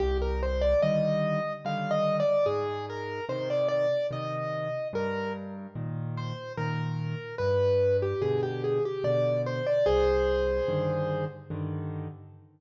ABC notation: X:1
M:3/4
L:1/16
Q:1/4=73
K:Cm
V:1 name="Acoustic Grand Piano"
G B c d e4 (3f2 e2 d2 | A2 B2 c d d2 e4 | B2 z4 c2 B4 | =B3 G A G A G d2 c d |
[Ac]8 z4 |]
V:2 name="Acoustic Grand Piano" clef=bass
C,,4 [D,E,G,]4 [D,E,G,]4 | A,,4 [C,E,]4 [C,E,]4 | G,,4 [B,,E,]4 [B,,E,]4 | G,,4 [=B,,D,]4 [B,,D,]4 |
C,,4 [G,,D,E,]4 [G,,D,E,]4 |]